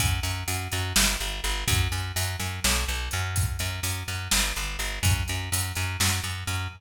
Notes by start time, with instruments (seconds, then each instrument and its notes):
0.00 electric bass (finger) F#2, kick, closed hi-hat
0.23 electric bass (finger) F#2, closed hi-hat
0.48 electric bass (finger) F#2, closed hi-hat
0.72 electric bass (finger) F#2, closed hi-hat
0.96 electric bass (finger) G1, snare
1.20 electric bass (finger) G1, closed hi-hat
1.44 electric bass (finger) G1, closed hi-hat
1.68 electric bass (finger) F#2, kick, closed hi-hat
1.92 electric bass (finger) F#2, closed hi-hat
2.16 electric bass (finger) F#2, closed hi-hat
2.40 electric bass (finger) F#2, closed hi-hat
2.64 electric bass (finger) B1, snare
2.88 electric bass (finger) B1, closed hi-hat
3.11 electric bass (finger) F#2, closed hi-hat
3.36 kick, closed hi-hat
3.59 electric bass (finger) F#2, closed hi-hat
3.83 electric bass (finger) F#2, closed hi-hat
4.08 electric bass (finger) F#2, closed hi-hat
4.31 electric bass (finger) G1, snare
4.56 electric bass (finger) G1, closed hi-hat
4.79 electric bass (finger) G1, closed hi-hat
5.03 electric bass (finger) F#2, kick, closed hi-hat
5.28 electric bass (finger) F#2, closed hi-hat
5.52 electric bass (finger) F#2, closed hi-hat
5.75 electric bass (finger) F#2, closed hi-hat
6.00 electric bass (finger) F#2, snare
6.24 electric bass (finger) F#2, closed hi-hat
6.47 electric bass (finger) F#2, closed hi-hat